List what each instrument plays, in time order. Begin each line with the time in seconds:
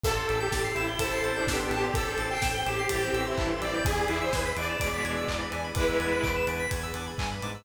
0.03 synth bass 1 A1, drawbar organ C4 E4 G4 A4, pad 5 (bowed) C4 E4 G4 A4, lead 2 (sawtooth) A4, electric piano 2 A5, kick, crash
0.17 electric piano 2 C6
0.28 synth bass 1 A1, drawbar organ C4 E4 G4 A4, electric piano 2 E6, ride
0.40 lead 2 (sawtooth) G4, electric piano 2 G6
0.52 synth bass 1 A1, electric piano 2 A6, kick, snare
0.64 electric piano 2 C7
0.74 synth bass 1 A1, drawbar organ C4 E4 G4 A4, lead 2 (sawtooth) E4, electric piano 2 E7, ride
0.88 electric piano 2 G7
0.99 synth bass 1 A1, violin E4 C5, lead 2 (sawtooth) A4, electric piano 2 E7, kick, ride
1.11 violin E4 C5, electric piano 2 C7
1.22 synth bass 1 A1, drawbar organ C4 E4 G4 A4, electric piano 2 A6, ride
1.36 lead 2 (sawtooth) D4, electric piano 2 G6
1.47 synth bass 1 A1, violin B3 G4, electric piano 2 E6, kick, snare
1.59 electric piano 2 C6
1.70 synth bass 1 A1, drawbar organ C4 E4 G4 A4, lead 2 (sawtooth) G4, electric piano 2 A5, ride
1.83 electric piano 2 C6
1.94 synth bass 1 A1, pad 5 (bowed) C4 E4 A4 C5, lead 2 (sawtooth) A4, electric piano 2 E6, kick, ride
2.07 electric piano 2 G6
2.17 synth bass 1 A1, drawbar organ C4 E4 G4 A4, electric piano 2 A6, ride
2.30 lead 2 (sawtooth) G5, electric piano 2 C7
2.42 synth bass 1 A1, electric piano 2 E7, kick, snare
2.54 electric piano 2 G7
2.66 synth bass 1 A1, drawbar organ C4 E4 G4 A4, lead 2 (sawtooth) G4, electric piano 2 E7, ride
2.78 electric piano 2 C7
2.89 synth bass 1 A1, violin G3 E4, lead 2 (sawtooth) G4, electric piano 2 A6, kick, ride
3.02 violin E3 C4, electric piano 2 G6
3.13 synth bass 1 A1, drawbar organ C4 E4 G4 A4, electric piano 2 E6, ride
3.26 lead 2 (sawtooth) E4, electric piano 2 C6
3.37 synth bass 1 A1, violin G2 E3, electric piano 2 A5, kick, clap
3.50 electric piano 2 C6
3.61 synth bass 1 A1, drawbar organ C4 E4 G4 A4, lead 2 (sawtooth) D5, electric piano 2 E6, ride
3.74 electric piano 2 G6
3.85 synth bass 1 E2, drawbar organ B3 D4 E4 G#4, pad 5 (bowed) B3 D4 E4 G#4, lead 2 (sawtooth) G#4, electric piano 2 G#5, kick, ride
3.97 electric piano 2 B5
4.08 synth bass 1 E2, drawbar organ B3 D4 E4 G#4, lead 2 (sawtooth) E4, electric piano 2 D6, ride
4.21 lead 2 (sawtooth) C5, electric piano 2 E6
4.33 synth bass 1 E2, lead 2 (sawtooth) B4, electric piano 2 G#6, kick, snare
4.45 electric piano 2 B6
4.56 synth bass 1 E2, drawbar organ B3 D4 E4 G#4, lead 2 (sawtooth) D5, electric piano 2 D7, ride
4.69 electric piano 2 E7
4.80 synth bass 1 E2, violin B2 G#3, electric piano 2 D7, kick, ride
4.93 violin B2 G#3, electric piano 2 B6
5.05 synth bass 1 E2, drawbar organ B3 D4 E4 G#4, electric piano 2 G#6, ride
5.16 electric piano 2 E6
5.28 synth bass 1 E2, violin G#2 E3, electric piano 2 D6, kick, clap
5.40 electric piano 2 B5
5.52 synth bass 1 E2, drawbar organ B3 D4 E4 G#4, electric piano 2 G#5, ride
5.64 electric piano 2 B5
5.75 synth bass 1 E2, violin G#3 E4, pad 5 (bowed) B3 D4 G#4 B4, lead 2 (sawtooth) B4, electric piano 2 D6, kick, ride
5.88 electric piano 2 E6
6.00 synth bass 1 E2, drawbar organ B3 D4 E4 G#4, electric piano 2 G#6, ride
6.12 electric piano 2 B6
6.23 synth bass 1 E2, electric piano 2 D7, kick, clap
6.36 electric piano 2 E7
6.47 synth bass 1 E2, drawbar organ B3 D4 E4 G#4, electric piano 2 D7, ride
6.59 electric piano 2 B6
6.71 synth bass 1 E2, electric piano 2 G#6, kick, ride
6.83 electric piano 2 E6
6.94 synth bass 1 E2, drawbar organ B3 D4 E4 G#4, electric piano 2 D6, ride
7.07 electric piano 2 B5
7.18 synth bass 1 G2, electric piano 2 G#5, kick, clap
7.31 electric piano 2 B5
7.42 synth bass 1 G#2, drawbar organ B3 D4 E4 G#4, electric piano 2 D6, ride
7.54 electric piano 2 E6